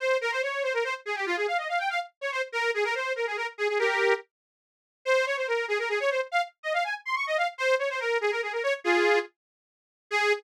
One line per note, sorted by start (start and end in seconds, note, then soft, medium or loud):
0.00 0.17 C5 medium
0.21 0.31 A#4 medium
0.32 0.42 C5 medium
0.42 0.63 C#5 medium
0.63 0.73 C5 medium
0.74 0.84 A#4 medium
0.84 0.94 C5 medium
1.06 1.16 G#4 medium
1.16 1.26 G4 medium
1.26 1.36 F4 medium
1.36 1.46 G#4 medium
1.47 1.57 F5 medium
1.58 1.68 D#5 medium
1.69 1.79 F5 medium
1.79 1.89 G5 medium
1.90 2.00 F5 medium
2.21 2.31 C#5 medium
2.32 2.42 C5 medium
2.52 2.71 A#4 medium
2.74 2.84 G#4 medium
2.84 2.94 A#4 medium
2.95 3.13 C5 medium
3.16 3.26 A#4 medium
3.27 3.37 G#4 medium
3.37 3.47 A#4 medium
3.58 3.68 G#4 medium
3.68 3.78 G#4 medium
3.79 4.14 G4 medium
3.79 4.14 A#4 medium
5.05 5.25 C5 medium
5.26 5.36 C#5 medium
5.37 5.47 C5 medium
5.47 5.66 A#4 medium
5.68 5.78 G#4 medium
5.79 5.89 A#4 medium
5.89 5.99 G#4 medium
6.00 6.10 C#5 medium
6.11 6.21 C5 medium
6.32 6.42 F5 medium
6.63 6.73 D#5 medium
6.74 6.84 F5 medium
6.84 6.94 G#5 medium
7.05 7.15 C6 medium
7.16 7.26 C#6 medium
7.27 7.37 D#5 medium
7.37 7.47 F5 medium
7.58 7.75 C5 medium
7.79 7.89 C#5 medium
7.90 8.00 C5 medium
8.00 8.18 A#4 medium
8.21 8.31 G#4 medium
8.31 8.41 A#4 medium
8.42 8.52 G#4 medium
8.53 8.63 A#4 medium
8.63 8.73 C#5 medium
8.84 9.19 F4 medium
8.84 9.19 G#4 medium
10.11 10.33 G#4 loud